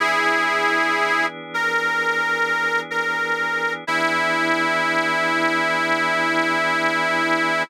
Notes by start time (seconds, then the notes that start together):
0.00 E3 B3 D4 E4 G#4
1.54 A#4
2.91 A#4
3.87 E3 B3 D4 E4 G#4